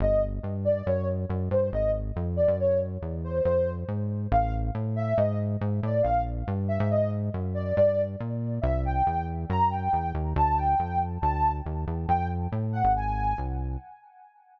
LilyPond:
<<
  \new Staff \with { instrumentName = "Ocarina" } { \time 2/2 \key c \lydian \tempo 2 = 139 dis''4 r2 d''4 | cis''4 r2 c''4 | ees''4 r2 d''4 | cis''4 r2 c''4 |
c''4. r2 r8 | \key d \lydian eis''4 r2 e''4 | dis''4 r2 d''4 | f''4 r2 e''4 |
dis''4 r2 d''4 | d''4. r2 r8 | \key c \lydian e''4 g''2 r4 | ais''4 g''2 r4 |
a''4 g''2 r4 | a''4. r2 r8 | \key d \lydian g''4 r2 fis''4 | gis''2 r2 | }
  \new Staff \with { instrumentName = "Synth Bass 1" } { \clef bass \time 2/2 \key c \lydian g,,2 g,2 | fis,2 fis,4 g,4 | aes,,2 f,4. fis,8~ | fis,2 e,2 |
f,2 aes,2 | \key d \lydian a,,2 a,2 | gis,2 gis,4 a,4 | bes,,2 g,4. gis,8~ |
gis,2 fis,2 | g,2 bes,2 | \key c \lydian c,2 e,2 | fis,2 e,4 dis,4 |
d,2 f,2 | d,2 dis,4 e,4 | \key d \lydian f,2 a,4. gis,,8~ | gis,,2 bis,,2 | }
>>